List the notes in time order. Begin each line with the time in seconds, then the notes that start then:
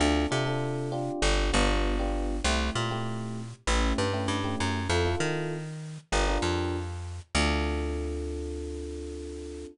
0.00 D2 C4 D4 F4 A4
0.31 C3 C4 D4 F4 A4
0.46 C4 D4 F4 A4
0.92 C4 D4 F4 G4
1.22 G1
1.53 G1 B3 D4 F4 G4
1.99 B3 D4 F4 G4
2.44 C2 A3 C4 E4 G4
2.75 A#2 A3 C4 E4 G4
2.91 A3 C4 E4 G4
3.67 A1 A3 C#4 E4 G4
3.98 G2
4.13 A3 C#4 E4 G4
4.28 G2
4.44 A3 C#4 E4 G4
4.60 F#2
4.89 F2 C4 E4 F4 A4
5.05 C4 E4 F4 A4
5.20 D#3
6.12 G1 D4 F4 G4 A#4
6.27 D4 F4 G4 A#4
6.42 F2
7.35 D2 C4 D4 F4 A4